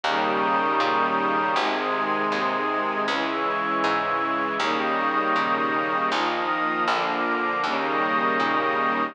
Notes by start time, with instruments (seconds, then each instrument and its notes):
0.03 electric bass (finger) D#2, string ensemble 1 C#3 D#3 G3 A#3, pad 5 (bowed) A#5 C#6 D#6 G6
0.80 electric bass (finger) A#2
1.56 electric bass (finger) G#1, string ensemble 1 C3 D#3 G#3, pad 5 (bowed) C6 D#6 G#6
2.32 electric bass (finger) D#2
3.07 electric bass (finger) C#2, string ensemble 1 C#3 E3 G#3, pad 5 (bowed) C#6 E6 G#6
3.84 electric bass (finger) G#2
4.59 electric bass (finger) D#2, string ensemble 1 C#3 D#3 G3 A#3, pad 5 (bowed) C#6 D#6 G6 A#6
5.36 electric bass (finger) A#2
6.11 electric bass (finger) A#1, string ensemble 1 D#3 F3 A#3, pad 5 (bowed) D#6 F6 A#6
6.87 electric bass (finger) A#1, string ensemble 1 D3 F3 A#3, pad 5 (bowed) D6 F6 A#6
7.63 electric bass (finger) D#2, string ensemble 1 C#3 D#3 G3 A#3, pad 5 (bowed) C#6 D#6 G6 A#6
8.40 electric bass (finger) A#2